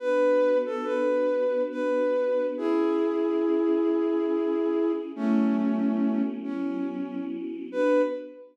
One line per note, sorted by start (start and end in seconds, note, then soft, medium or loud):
0.00 2.55 B3 medium
0.00 2.55 D4 medium
0.00 2.55 F#4 medium
0.00 0.58 B4 loud
0.66 0.86 A4 medium
0.84 1.62 B4 medium
1.71 2.46 B4 medium
2.57 5.12 C#4 medium
2.57 5.12 E4 medium
2.57 4.92 E4 medium
2.57 5.12 G#4 medium
2.57 4.92 G#4 medium
5.14 7.69 F#3 medium
5.14 6.23 A3 medium
5.14 7.69 B3 medium
5.14 7.69 C#4 medium
5.14 6.23 C#4 loud
5.14 7.69 E4 medium
6.44 7.24 C#4 medium
7.72 8.02 B3 loud
7.72 8.02 D4 loud
7.72 8.02 F#4 loud
7.72 8.02 B4 loud